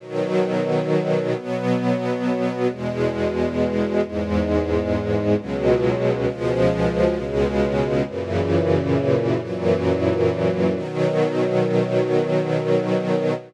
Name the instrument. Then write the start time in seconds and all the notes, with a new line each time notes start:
string ensemble 1
0.00 B2 D#3 F#3
1.35 B2 F#3 B3
2.69 E2 B2 G#3
4.02 E2 G#2 G#3
5.37 C#2 B2 F#3 G#3
6.26 C#2 B2 F3 G#3
7.15 C#2 B2 C#3 G#3
8.07 F#2 A#2 C#3 E3
9.41 F#2 A#2 E3 F#3
10.75 B2 D#3 F#3